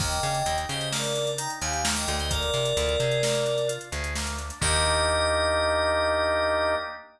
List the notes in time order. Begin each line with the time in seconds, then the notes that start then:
0.00 D#2 A#3 D#5 G5, kick, crash
0.12 closed hi-hat
0.23 C#3 D4, closed hi-hat
0.35 closed hi-hat
0.46 D#2 D#4, closed hi-hat
0.58 closed hi-hat
0.69 C#3 G4 C5 D#5, closed hi-hat
0.81 closed hi-hat
0.92 A#3 A#4 D5, snare
1.04 closed hi-hat
1.15 D4, closed hi-hat
1.27 closed hi-hat
1.38 D#4 G5 A#5, closed hi-hat
1.50 closed hi-hat
1.61 D#2 G4 F5 G#5, closed hi-hat
1.73 closed hi-hat
1.84 A#3, snare
1.95 D#5 G5, closed hi-hat
2.08 D2 D4, closed hi-hat
2.19 C5 D#5, closed hi-hat
2.30 A#3 A#4 D5, kick, closed hi-hat
2.42 closed hi-hat
2.54 C3 D4, closed hi-hat
2.65 closed hi-hat
2.77 D2 F4, closed hi-hat
2.89 closed hi-hat
3.00 C3 G#4, closed hi-hat
3.11 closed hi-hat
3.23 A#3, snare
3.35 closed hi-hat
3.46 D4, closed hi-hat
3.58 closed hi-hat
3.68 F4, closed hi-hat
3.81 closed hi-hat
3.92 D2 G#4, closed hi-hat
4.04 closed hi-hat
4.15 A#3, snare
4.27 closed hi-hat
4.38 D4, closed hi-hat
4.50 closed hi-hat
4.61 D#2 A#3 D4 D#4 G4 D#5, kick, crash